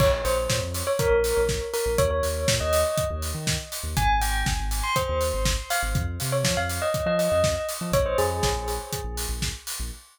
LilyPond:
<<
  \new Staff \with { instrumentName = "Tubular Bells" } { \time 4/4 \key bes \dorian \tempo 4 = 121 des''16 r16 c''8 r8. des''16 bes'4 r8 bes'16 r16 | des''16 des''4 ees''8. r2 | aes''16 r16 g''8 r8. c'''16 c''4 r8 f''16 r16 | r8. des''16 r16 f''16 r16 ees''8 ees''16 ees''4 r8 |
des''16 c''16 aes'4 r2 r8 | }
  \new Staff \with { instrumentName = "Synth Bass 2" } { \clef bass \time 4/4 \key bes \dorian bes,,8 bes,,8 bes,16 f,4 bes,,8 bes,,4 bes,,16 | ees,8 ees,8 bes,16 ees,4 ees,8 ees4 ees,16 | aes,,8 aes,,8 aes,,16 aes,,4 ees,8 aes,,4 aes,,16 | f,8 c8 f16 f,4 f8 f,4 f16 |
bes,,8 f,8 bes,,16 bes,,4 bes,,8 bes,,4 bes,,16 | }
  \new DrumStaff \with { instrumentName = "Drums" } \drummode { \time 4/4 <cymc bd>8 hho8 <bd sn>8 hho8 <hh bd>8 hho8 <bd sn>8 hho8 | <hh bd>8 hho8 <bd sn>8 hho8 <hh bd>8 hho8 <bd sn>8 hho8 | <hh bd>8 hho8 <bd sn>8 hho8 <hh bd>8 hho8 <bd sn>8 hho8 | <hh bd>8 hho8 <bd sn>8 hho8 <hh bd>8 hho8 <bd sn>8 hho8 |
<hh bd>8 hho8 <bd sn>8 hho8 <hh bd>8 hho8 <bd sn>8 hho8 | }
>>